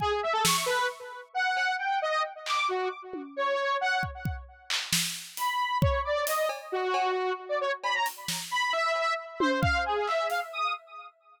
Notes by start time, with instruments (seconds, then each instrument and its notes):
0.00 lead 1 (square) G#4, kick
0.23 lead 1 (square) E5
0.33 lead 1 (square) A4
0.44 lead 1 (square) C#6, snare
0.66 lead 1 (square) B4
1.34 lead 1 (square) F#5
1.57 cowbell
1.79 lead 1 (square) G5
2.02 lead 1 (square) D#5
2.46 lead 1 (square) D6, clap
2.68 lead 1 (square) F#4
3.13 high tom
3.36 lead 1 (square) C#5
3.81 lead 1 (square) F#5
4.03 kick
4.25 kick
4.70 clap
4.93 snare
5.37 lead 1 (square) B5, closed hi-hat
5.81 lead 1 (square) C#5, kick
6.05 lead 1 (square) D5
6.27 lead 1 (square) D#5, closed hi-hat
6.49 cowbell
6.72 lead 1 (square) F#4
6.94 cowbell
7.49 lead 1 (square) D5
7.61 lead 1 (square) C#5
7.84 lead 1 (square) B5, cowbell
7.95 lead 1 (square) A#5
8.06 closed hi-hat
8.28 snare
8.51 lead 1 (square) B5
8.73 lead 1 (square) E5
8.96 cowbell
9.40 lead 1 (square) C5, high tom
9.61 lead 1 (square) F5, kick
9.86 lead 1 (square) G#4
10.07 lead 1 (square) E5, clap
10.30 lead 1 (square) F5, closed hi-hat
10.53 lead 1 (square) D#6